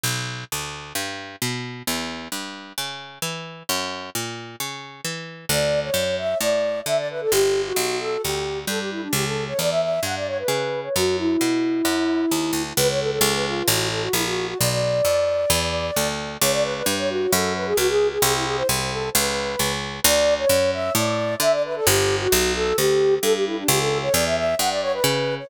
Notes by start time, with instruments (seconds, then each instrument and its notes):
0.04 harpsichord B1
0.52 harpsichord D2
0.95 harpsichord G2
1.42 harpsichord B2
1.87 harpsichord E2
2.32 harpsichord G2
2.78 harpsichord C#3
3.22 harpsichord E3
3.69 harpsichord F#2
4.15 harpsichord A#2
4.60 harpsichord C#3
5.05 harpsichord E3
5.49 harpsichord D2, flute D5
5.83 flute C#5
5.94 harpsichord F#2
6.18 flute E5
6.41 harpsichord A2, flute D5
6.86 harpsichord D3, flute E5
6.97 flute D5
7.10 flute B4
7.21 flute A4
7.32 harpsichord G1, flute G4
7.66 flute F#4
7.76 harpsichord B1
8.00 flute A4
8.23 harpsichord D2, flute G4
8.67 harpsichord G2, flute A4
8.80 flute G4
8.91 flute E4
9.02 flute D4
9.13 harpsichord C#2, flute G4
9.26 flute A4
9.48 flute C#5
9.59 harpsichord E2, flute D5
9.71 flute E5
9.82 flute E5
10.03 harpsichord G2, flute F#5
10.16 flute D5
10.27 flute C#5
10.39 flute B4
10.48 harpsichord C#3
10.84 flute C#5
10.96 harpsichord F#2, flute F#4
11.18 flute E4
11.41 harpsichord B2
11.85 harpsichord F#2
12.31 harpsichord D#2
12.53 harpsichord D2
12.77 harpsichord C#2, flute B4
12.89 flute C#5
13.00 flute A4
13.11 flute A4
13.21 harpsichord C#2
13.34 flute B4
13.46 flute F4
13.68 harpsichord A1, flute F#4
13.91 flute A4
14.02 flute F#4
14.13 harpsichord A#1, flute E4
14.25 flute F#4
14.47 flute F#4
14.59 harpsichord B1, flute D5
14.70 flute D5
15.05 harpsichord F2
15.50 harpsichord E2
15.96 harpsichord D2
16.41 harpsichord C#2, flute C#5
16.52 flute D5
16.63 flute B4
16.75 flute B4
16.86 harpsichord G2
16.98 flute C#5
17.09 flute F#4
17.31 harpsichord F#2, flute A4
17.55 flute B4
17.66 flute G#4
17.77 harpsichord C#2, flute F#4
17.89 flute G#4
18.11 flute G#4
18.22 harpsichord C2, flute G#4
18.34 flute E4
18.46 flute G#4
18.57 flute C5
18.69 harpsichord C2
18.91 flute A4
19.14 harpsichord C#2, flute B4
19.59 harpsichord C#2
20.04 harpsichord D2, flute D5
20.38 flute C#5
20.49 harpsichord F#2
20.73 flute E5
20.95 harpsichord A2, flute D5
21.40 harpsichord D3, flute E5
21.52 flute D5
21.64 flute B4
21.76 flute A4
21.86 harpsichord G1, flute G4
22.21 flute F#4
22.32 harpsichord B1
22.55 flute A4
22.78 harpsichord D2, flute G4
23.22 harpsichord G2, flute A4
23.34 flute G4
23.46 flute E4
23.57 flute D4
23.68 harpsichord C#2, flute G4
23.80 flute A4
24.02 flute C#5
24.14 harpsichord E2, flute D5
24.26 flute E5
24.37 flute E5
24.59 harpsichord G2, flute F#5
24.70 flute D5
24.82 flute C#5
24.93 flute B4
25.04 harpsichord C#3
25.39 flute C#5